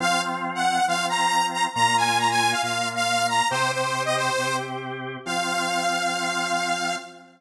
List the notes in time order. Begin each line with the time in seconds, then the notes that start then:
0.00 F3 C4 F4 F5
0.55 F#5
0.88 F3 C4 F4 F5
1.09 A#5
1.53 A#5
1.75 A#2 A#3 F4 A#5
1.97 G#5
2.19 A#5
2.30 G#5
2.52 F5
2.62 A#2 A#3 F4 F5
2.95 F5
3.29 A#5
3.50 C3 C4 G4 C5
3.72 C5
4.05 D#5
4.16 C5
4.38 C3 C4 G4
5.26 F3 C4 F4 F5